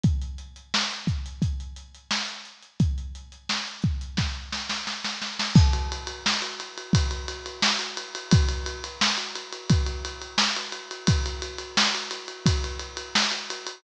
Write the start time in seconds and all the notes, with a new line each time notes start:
0.03 kick, closed hi-hat
0.22 closed hi-hat
0.38 closed hi-hat
0.56 closed hi-hat
0.74 snare
0.91 closed hi-hat
1.07 kick, closed hi-hat
1.26 closed hi-hat
1.42 kick, closed hi-hat
1.60 closed hi-hat
1.76 closed hi-hat
1.95 closed hi-hat
2.11 snare
2.28 closed hi-hat
2.45 closed hi-hat
2.62 closed hi-hat
2.80 kick, closed hi-hat
2.98 closed hi-hat
3.15 closed hi-hat
3.32 closed hi-hat
3.49 snare
3.67 closed hi-hat
3.82 kick, closed hi-hat
4.01 closed hi-hat
4.17 kick, snare
4.52 snare
4.69 snare
4.87 snare
5.04 snare
5.22 snare
5.39 snare
5.55 kick, crash
5.73 ride
5.92 ride
6.07 ride
6.26 snare
6.42 ride
6.60 ride
6.78 ride
6.93 kick, ride
7.11 ride
7.28 ride
7.46 ride
7.62 snare
7.79 ride
7.97 ride
8.15 ride
8.31 kick, ride
8.49 ride
8.66 ride
8.84 ride
9.01 snare
9.18 ride
9.35 ride
9.52 ride
9.70 kick, ride
9.86 ride
10.05 ride
10.22 ride
10.38 snare
10.56 ride
10.72 ride
10.91 ride
11.07 kick, ride
11.26 ride
11.42 ride
11.58 ride
11.77 snare
11.95 ride
12.11 ride
12.28 ride
12.46 kick, ride
12.64 ride
12.79 ride
12.97 ride
13.15 snare
13.31 ride
13.50 ride
13.67 ride